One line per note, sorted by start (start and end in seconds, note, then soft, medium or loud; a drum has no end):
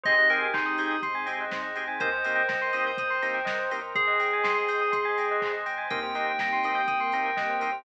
0.03 0.26 G#1 loud
0.03 0.14 C4 loud
0.03 1.02 C4 medium
0.03 0.14 D#4 medium
0.03 1.02 D#4 medium
0.03 0.14 G4 loud
0.03 1.02 G4 loud
0.03 0.14 G#4 loud
0.03 1.02 G#4 medium
0.03 0.14 C5 loud
0.03 0.28 D#5 loud
0.03 kick medium
0.03 closed hi-hat medium
0.18 0.29 D#5 medium
0.29 0.51 G#1 medium
0.29 0.47 C4 medium
0.29 0.47 D#4 medium
0.29 0.47 G4 medium
0.29 0.47 G#4 loud
0.29 0.51 A#4 medium
0.29 0.41 G5 medium
0.29 open hi-hat medium
0.42 0.53 G#5 medium
0.54 0.75 G#1 medium
0.54 0.96 D#4 medium
0.54 0.65 C6 medium
0.54 kick medium
0.54 clap loud
0.66 0.77 D#6 medium
0.78 0.99 G#1 medium
0.78 0.95 C4 medium
0.78 0.95 D#4 medium
0.78 0.95 G4 medium
0.78 0.95 G#4 medium
0.78 0.90 G6 medium
0.78 open hi-hat medium
0.91 1.02 D#6 medium
1.02 1.23 G#1 medium
1.02 1.99 C4 medium
1.02 1.99 D#4 medium
1.02 1.99 G#4 medium
1.02 1.99 C5 medium
1.02 1.14 C6 medium
1.02 kick medium
1.02 closed hi-hat medium
1.15 1.26 G#5 medium
1.26 1.48 G#1 loud
1.26 1.44 C4 loud
1.26 1.44 D#4 medium
1.26 1.44 G4 medium
1.26 1.44 G#4 medium
1.26 1.37 G5 medium
1.26 open hi-hat medium
1.40 1.51 D#5 medium
1.51 1.72 G#1 medium
1.51 1.64 C5 medium
1.51 kick medium
1.51 snare medium
1.62 1.73 D#5 medium
1.75 1.97 G#1 medium
1.75 1.84 C4 medium
1.75 1.84 D#4 medium
1.75 1.84 G4 medium
1.75 1.84 G#4 medium
1.75 1.86 G5 medium
1.75 open hi-hat medium
1.88 1.98 G#5 medium
2.00 2.21 C2 loud
2.00 2.09 A#3 loud
2.00 2.09 C4 loud
2.00 2.09 D#4 loud
2.00 2.09 G4 medium
2.00 2.11 A#4 medium
2.00 2.97 A#4 medium
2.00 2.97 C5 medium
2.00 3.71 C5 loud
2.00 2.97 D#5 medium
2.00 2.97 G5 medium
2.00 kick medium
2.00 closed hi-hat loud
2.12 2.23 C5 medium
2.24 2.46 C2 medium
2.24 2.42 A#3 loud
2.24 2.42 C4 medium
2.24 2.42 D#4 medium
2.24 2.42 G4 medium
2.24 2.35 D#5 medium
2.24 open hi-hat medium
2.35 2.46 G5 medium
2.48 2.70 C2 loud
2.48 2.59 A#5 medium
2.48 kick medium
2.48 snare medium
2.62 2.73 C6 medium
2.73 2.94 C2 medium
2.73 2.91 A#3 medium
2.73 2.91 C4 medium
2.73 2.91 D#4 medium
2.73 2.91 G4 medium
2.73 2.84 D#6 medium
2.73 open hi-hat medium
2.86 2.97 G6 medium
2.97 3.19 C2 medium
2.97 3.95 A#4 medium
2.97 3.95 C5 medium
2.97 3.95 G5 medium
2.97 3.95 A#5 medium
2.97 3.10 D#6 medium
2.97 kick medium
2.97 closed hi-hat medium
3.10 3.21 C6 medium
3.22 3.43 C2 medium
3.22 3.39 A#3 medium
3.22 3.39 C4 medium
3.22 3.39 D#4 medium
3.22 3.39 G4 medium
3.22 3.33 A#5 medium
3.22 open hi-hat medium
3.34 3.45 G5 medium
3.45 3.68 C2 medium
3.45 3.56 D#5 medium
3.45 kick medium
3.45 snare loud
3.59 3.70 C5 medium
3.71 3.92 C2 medium
3.71 3.79 A#3 medium
3.71 3.79 C4 medium
3.71 3.79 D#4 medium
3.71 3.79 G4 medium
3.71 3.83 A#4 medium
3.71 open hi-hat medium
3.82 3.92 C5 medium
3.95 4.16 G#1 medium
3.95 5.54 G#4 loud
3.95 4.92 C5 medium
3.95 4.07 C5 medium
3.95 4.92 D#5 medium
3.95 4.92 G5 medium
3.95 4.92 G#5 medium
3.95 kick medium
3.95 closed hi-hat medium
4.07 4.18 D#5 medium
4.20 4.40 G#1 medium
4.20 4.31 G5 medium
4.20 open hi-hat medium
4.33 4.44 G#5 medium
4.43 4.65 G#1 medium
4.43 4.54 C6 medium
4.43 kick medium
4.43 snare loud
4.58 4.69 D#6 medium
4.68 4.90 G#1 medium
4.68 4.80 G6 medium
4.68 open hi-hat medium
4.81 4.92 D#6 medium
4.92 5.14 G#1 medium
4.92 5.90 C5 medium
4.92 5.90 D#5 medium
4.92 5.90 G#5 medium
4.92 5.03 C6 medium
4.92 5.90 C6 medium
4.92 kick medium
4.92 closed hi-hat loud
5.05 5.16 G#5 medium
5.17 5.38 G#1 loud
5.17 5.29 G5 medium
5.17 open hi-hat medium
5.31 5.42 D#5 medium
5.41 5.63 G#1 medium
5.41 5.52 C5 medium
5.41 kick medium
5.41 clap medium
5.52 5.63 D#5 medium
5.66 5.87 G#1 medium
5.66 5.77 G5 medium
5.66 open hi-hat medium
5.78 5.89 G#5 medium
5.90 6.11 C2 loud
5.90 5.99 A#3 loud
5.90 6.87 A#3 medium
5.90 5.99 C4 loud
5.90 6.87 C4 medium
5.90 5.99 D#4 loud
5.90 6.87 D#4 medium
5.90 5.99 G4 loud
5.90 6.87 G4 medium
5.90 6.02 A#4 loud
5.90 7.78 G5 medium
5.90 kick medium
5.90 closed hi-hat medium
6.03 6.14 C5 medium
6.15 6.36 C2 medium
6.15 6.32 A#3 medium
6.15 6.32 C4 medium
6.15 6.32 D#4 medium
6.15 6.32 G4 medium
6.15 6.26 D#5 medium
6.15 open hi-hat medium
6.27 6.38 G5 medium
6.39 6.60 C2 medium
6.39 6.51 A#5 medium
6.39 kick medium
6.39 snare loud
6.52 6.63 C6 medium
6.64 6.84 C2 loud
6.64 6.81 A#3 medium
6.64 6.81 C4 medium
6.64 6.81 D#4 medium
6.64 6.81 G4 medium
6.64 6.76 D#6 medium
6.64 open hi-hat medium
6.75 6.86 G6 medium
6.88 7.09 C2 medium
6.88 7.84 A#3 medium
6.88 7.84 C4 medium
6.88 7.84 G4 medium
6.88 7.84 A#4 medium
6.88 6.99 D#6 medium
6.88 kick medium
6.88 closed hi-hat medium
7.00 7.11 C6 medium
7.12 7.34 C2 medium
7.12 7.30 A#3 medium
7.12 7.30 C4 medium
7.12 7.30 D#4 medium
7.12 7.30 G4 medium
7.12 7.24 A#5 medium
7.12 open hi-hat medium
7.26 7.37 G5 medium
7.37 7.57 C2 medium
7.37 7.48 D#5 medium
7.37 kick medium
7.37 snare medium
7.50 7.61 C5 medium
7.60 7.82 C2 medium
7.60 7.70 A#3 medium
7.60 7.70 C4 medium
7.60 7.70 D#4 medium
7.60 7.70 G4 medium
7.60 7.71 A#4 medium
7.60 open hi-hat medium
7.72 7.83 C5 medium